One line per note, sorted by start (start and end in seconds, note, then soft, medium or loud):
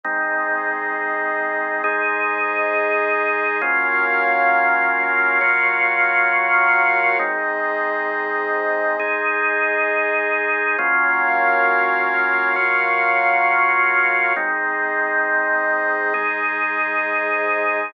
0.04 1.82 G#3 medium
0.04 1.82 C4 loud
0.04 1.82 D#4 medium
0.04 3.58 G#4 medium
0.04 3.58 C5 medium
0.04 3.58 D#5 medium
1.84 3.61 G#3 loud
1.84 3.61 D#4 medium
1.84 3.61 G#4 medium
3.62 5.39 F#3 medium
3.62 5.39 A#3 medium
3.62 5.39 C#4 medium
3.62 5.39 F4 medium
3.62 7.17 F#4 medium
3.62 7.17 A#4 medium
3.62 7.17 C#5 medium
3.62 7.17 F5 medium
5.41 7.18 F#3 medium
5.41 7.18 A#3 medium
5.41 7.18 F4 medium
5.41 7.18 F#4 medium
7.19 8.97 G#3 loud
7.19 8.97 C4 medium
7.19 8.97 D#4 medium
7.19 10.75 G#4 medium
7.19 10.75 C5 medium
7.19 10.75 D#5 medium
9.00 10.77 G#3 medium
9.00 10.77 D#4 medium
9.00 10.77 G#4 loud
10.78 12.55 F#3 medium
10.78 12.55 A#3 loud
10.78 12.56 C#4 medium
10.78 12.55 F4 medium
10.78 14.33 F#4 medium
10.78 14.33 A#4 medium
10.78 14.33 C#5 medium
10.78 14.33 F5 medium
12.56 14.33 F#3 medium
12.56 14.33 A#3 medium
12.56 14.33 F4 medium
12.56 14.33 F#4 medium
14.36 16.13 G#3 medium
14.36 16.14 C4 loud
14.36 16.13 D#4 medium
14.36 17.91 G#4 medium
14.36 17.91 C5 medium
14.36 17.91 D#5 medium
16.14 17.91 G#3 loud
16.14 17.91 D#4 medium
16.14 17.91 G#4 medium